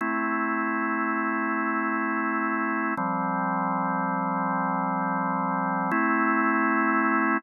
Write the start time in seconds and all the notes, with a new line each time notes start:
0.01 A3 C4 E4
2.97 F3 G3 C4
5.91 A3 C4 E4